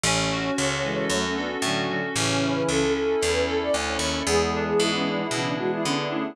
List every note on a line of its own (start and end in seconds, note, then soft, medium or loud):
0.03 0.51 A1 loud
0.03 0.84 C#4 medium
0.03 1.18 C#5 medium
0.32 1.10 F#4 medium
0.58 1.05 C#2 medium
0.58 1.36 A4 medium
0.83 1.07 E3 medium
0.83 1.07 G#3 loud
0.83 1.63 C#4 medium
1.09 1.57 F#2 medium
1.09 1.23 F#3 medium
1.09 1.23 A3 loud
1.09 1.89 F#4 medium
1.24 1.37 A3 medium
1.24 1.37 C#4 loud
1.36 1.48 B3 medium
1.36 1.48 D4 loud
1.36 2.12 A4 medium
1.62 2.09 A2 medium
1.62 1.86 D3 loud
1.62 1.86 F#3 loud
1.62 2.13 C#4 medium
1.88 2.01 D3 loud
1.88 2.01 F#3 loud
1.88 2.15 F#4 medium
2.15 2.63 A1 medium
2.15 2.82 C#3 loud
2.15 2.82 E3 loud
2.15 2.94 C#4 medium
2.15 2.53 C#5 loud
2.42 3.21 E4 medium
2.55 2.67 B4 medium
2.68 3.16 C#2 medium
2.68 3.47 A4 medium
2.68 2.92 A4 loud
2.94 3.73 C#4 medium
2.94 3.31 A4 medium
3.21 3.70 E2 medium
3.21 3.99 E4 medium
3.32 3.45 B4 medium
3.47 4.22 A4 medium
3.47 3.61 A4 medium
3.63 3.75 D5 medium
3.74 3.98 D2 medium
3.74 4.24 C#4 medium
3.88 3.98 C#5 medium
3.99 4.23 D#2 medium
3.99 4.25 E4 medium
3.99 4.20 C#5 medium
4.26 4.74 E2 medium
4.26 5.21 E3 loud
4.26 5.21 G#3 loud
4.26 5.84 B3 medium
4.26 4.48 G#4 loud
4.52 5.57 D4 medium
4.52 4.64 A4 medium
4.68 4.80 G#4 medium
4.79 5.27 G#2 medium
4.79 4.91 E4 medium
4.79 5.31 E4 medium
4.94 5.06 C#4 medium
5.05 5.19 D4 medium
5.05 6.30 G#4 medium
5.18 5.40 E4 medium
5.31 5.78 B2 medium
5.31 5.56 C#3 medium
5.31 5.56 E3 loud
5.31 6.32 E4 medium
5.45 5.57 D4 medium
5.58 5.83 E3 medium
5.58 5.83 G#3 loud
5.58 6.10 D4 medium
5.58 5.71 F#4 medium
5.72 5.85 E4 medium
5.84 6.33 D3 medium
5.84 6.34 B3 medium
5.84 6.07 B3 loud
5.84 5.97 C#4 medium
5.84 6.07 D4 loud
5.97 6.10 D4 medium
6.09 6.35 A3 medium
6.09 6.35 C#4 loud
6.09 6.35 D4 medium
6.09 6.33 E4 medium